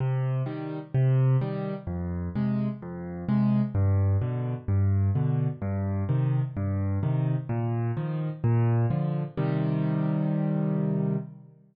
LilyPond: \new Staff { \clef bass \time 4/4 \key c \minor \tempo 4 = 128 c4 <ees g>4 c4 <ees g>4 | f,4 <c aes>4 f,4 <c aes>4 | g,4 <b, d>4 g,4 <b, d>4 | g,4 <c ees>4 g,4 <c ees>4 |
bes,4 <ees f>4 bes,4 <d f>4 | <c ees g>1 | }